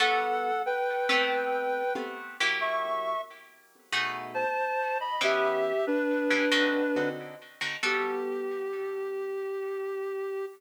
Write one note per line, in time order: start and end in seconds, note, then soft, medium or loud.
0.00 0.51 G3 loud
0.00 0.51 B3 loud
0.00 0.51 F#4 loud
0.00 0.51 A4 loud
0.00 0.62 A4 loud
0.00 0.62 F#5 loud
0.66 1.93 B4 loud
0.66 1.93 G5 loud
1.09 1.83 A3 loud
1.09 1.83 B3 loud
1.09 1.83 C4 loud
1.09 1.83 G4 loud
1.95 2.37 A3 medium
1.95 2.37 B3 loud
1.95 2.37 C4 medium
1.95 2.37 G4 medium
2.40 3.14 F#3 loud
2.40 3.14 A#3 loud
2.40 3.14 E4 loud
2.40 3.14 G4 loud
2.61 3.21 E5 loud
2.61 3.21 C#6 loud
3.92 4.45 B2 loud
3.92 4.45 A3 medium
3.92 4.45 D#4 loud
3.92 4.45 G#4 loud
4.34 4.98 C5 loud
4.34 4.98 A5 loud
5.00 5.21 D#5 medium
5.00 5.21 B5 loud
5.21 5.73 E3 medium
5.21 5.73 B3 loud
5.21 5.73 C#4 loud
5.21 5.73 G4 loud
5.21 5.85 G4 loud
5.21 5.85 E5 loud
5.87 7.09 D4 loud
5.87 7.09 B4 loud
6.30 6.46 E3 medium
6.30 6.46 B3 medium
6.30 6.46 C#4 medium
6.30 6.46 G4 medium
6.51 6.82 D3 loud
6.51 6.82 C4 loud
6.51 6.82 D#4 loud
6.51 6.82 F#4 loud
6.96 7.35 D3 medium
6.96 7.35 C4 medium
6.96 7.35 D#4 medium
6.96 7.35 F#4 loud
7.61 7.76 D3 medium
7.61 7.76 C4 medium
7.61 7.76 D#4 medium
7.61 7.76 F#4 medium
7.83 10.44 G3 loud
7.83 10.44 B3 loud
7.83 10.44 F#4 loud
7.83 10.46 G4 loud
7.83 10.44 A4 medium